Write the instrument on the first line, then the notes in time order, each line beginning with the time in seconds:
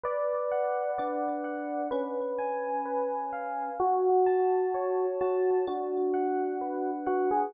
electric piano 1
0.04 B4 D5
0.52 F#5
0.98 D4 D5
1.44 F#5
1.91 C#4 B4
2.38 G#5
2.86 B4
3.33 F5
3.80 F#4
4.26 A5
4.74 C#5
5.21 F#4 A5
5.67 D4 F#4
6.14 F#5
6.61 B4
7.06 F#4 F#5
7.31 G#4